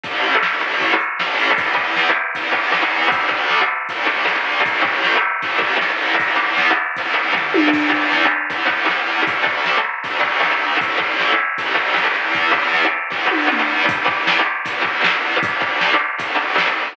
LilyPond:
<<
  \new Staff \with { instrumentName = "Overdriven Guitar" } { \time 4/4 \key e \dorian \tempo 4 = 156 <a, e a>4~ <a, e a>16 <a, e a>16 <a, e a>4. <a, e a>4 | <e, e b>8 <e, e b>4. <e, e b>8 <e, e b>8 <e, e b>16 <e, e b>8. | <d, d a>8 <d, d a>4. <d, d a>8 <d, d a>8 <d, d a>16 <d, d a>8. | <a, e a>8 <a, e a>4. <a, e a>8 <a, e a>8 <a, e a>16 <a, e a>8. |
<e, e b>8 <e, e b>4. <e, e b>8 <e, e b>8 <e, e b>16 <e, e b>8. | <e, e b>8 <e, e b>4. <e, e b>8 <e, e b>8 <e, e b>16 <e, e b>8. | <d, d a>8 <d, d a>4. <d, d a>8 <d, d a>8 <d, d a>16 <d, d a>8. | <a, e a>8 <a, e a>4. <a, e a>8 <a, e a>8 <a, e a>16 <a, e a>16 <e, e b>8~ |
<e, e b>8 <e, e b>4. <e, e b>8 <e, e b>8 <e, e b>16 <e, e b>8. | <e, e b>8 <e, e b>4. <e, e b>8 <e, e b>8 <e, e b>16 <e, e b>8. | <d, d a>8 <d, d a>4. <d, d a>8 <d, d a>8 <d, d a>16 <d, d a>8. | }
  \new DrumStaff \with { instrumentName = "Drums" } \drummode { \time 4/4 <hh bd>8 hh8 sn8 hh8 <hh bd>8 hh8 sn8 hho8 | <hh bd>8 bd8 sn4 <hh bd>8 bd8 sn4 | <hh bd>8 bd8 sn4 <hh bd>4 sn4 | <hh bd>8 bd8 sn4 <hh bd>8 bd8 sn4 |
<hh bd>4 sn4 <hh bd>4 <bd tomfh>8 tommh8 | <cymc bd>8 bd8 sn4 <hh bd>8 bd8 sn4 | <hh bd>8 bd8 sn4 <hh bd>8 bd8 sn4 | <hh bd>8 bd8 sn4 <hh bd>8 bd8 sn4 |
<hh bd>8 bd8 sn4 <bd sn>8 tommh8 toml4 | <hh bd>8 bd8 sn4 <hh bd>8 bd8 sn4 | <hh bd>8 bd8 sn4 <hh bd>4 sn4 | }
>>